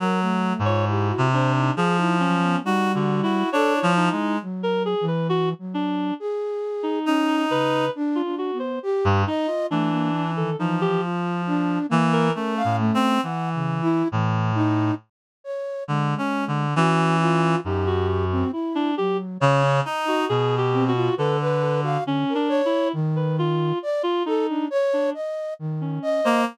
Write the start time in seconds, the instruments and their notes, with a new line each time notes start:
0.00 clarinet F#3, flute A#4
0.22 flute A3
0.59 clarinet G#2
0.65 flute F4, clarinet C#5
0.88 clarinet E4, flute G4
1.09 flute F#4
1.18 clarinet C3
1.32 clarinet D4, flute C5
1.56 flute D#4
1.77 clarinet F3 G#4
1.98 clarinet D#4, flute E4
2.20 flute F#3, clarinet C#4
2.42 flute B3
2.64 flute G3, clarinet D#4 F#4
2.94 clarinet D3 F#4
3.23 clarinet E4 F#4
3.52 clarinet D4 C#5, flute A4
3.75 flute E4
3.83 clarinet F3
3.97 clarinet D#4
4.12 clarinet G#3
4.42 flute F#3
4.63 clarinet A#4
4.85 clarinet G#4
5.01 flute E3
5.08 clarinet B4
5.29 clarinet F#4
5.59 flute F#3
5.74 clarinet D4
6.20 flute G#4
6.83 clarinet D#4
7.06 flute C#4, clarinet D#4
7.50 flute C#3, clarinet B4
7.95 flute D4
8.15 clarinet F4
8.25 flute D4
8.38 clarinet F#4
8.53 flute B3
8.59 clarinet C5
8.83 flute G4
9.05 clarinet G2
9.27 clarinet D#4, flute D#5
9.47 clarinet F4
9.70 clarinet E3 D4, flute A3
9.91 flute A#3
10.13 flute D4
10.36 flute D#3, clarinet A4
10.59 flute E3, clarinet F3 D#4
10.81 clarinet G4
11.02 flute F4
11.47 flute D4
11.89 clarinet E3, flute A#3
12.13 clarinet A#4
12.35 clarinet A3 C#4, flute A#4
12.57 flute F5
12.65 clarinet A2
12.79 flute A3
12.94 clarinet C4
13.23 clarinet E3, flute F#5
13.54 flute C#3
13.82 flute E4
14.12 clarinet A2, flute E3
14.55 flute D#4
15.44 flute C#5
15.88 clarinet D3, flute G#3
16.18 clarinet C#4
16.48 clarinet D3
16.76 clarinet E3 C#4, flute F#4
17.21 flute F4
17.65 clarinet F#2 D#4, flute G4
17.87 clarinet F#4
18.08 clarinet F#4
18.31 flute C4
18.52 flute E4, clarinet E4
18.75 clarinet D4
18.97 flute F#3, clarinet G4
19.40 clarinet C#3, flute C#5
19.63 clarinet C#4
19.85 clarinet D#4, flute D#5
20.08 clarinet F#4
20.29 clarinet B2 G#4
20.58 clarinet G4
20.73 flute C4
20.88 clarinet F#4
20.95 flute F4
21.17 clarinet D3 A4, flute B4
21.41 flute B4
21.62 clarinet A4
21.83 clarinet F#4, flute F5
22.05 flute D3, clarinet C#4
22.29 flute A#4
22.35 clarinet D4
22.49 flute C#5
22.65 clarinet E4
22.93 flute D#3
23.16 clarinet B4
23.39 clarinet F4
23.83 flute D5
24.03 clarinet F4
24.26 clarinet D#4, flute A4
24.48 flute D4
24.70 flute C#5
24.93 clarinet D4
25.14 flute D#5
25.59 flute D#3
25.81 clarinet C#4
26.02 flute D#5
26.24 clarinet A#3 C5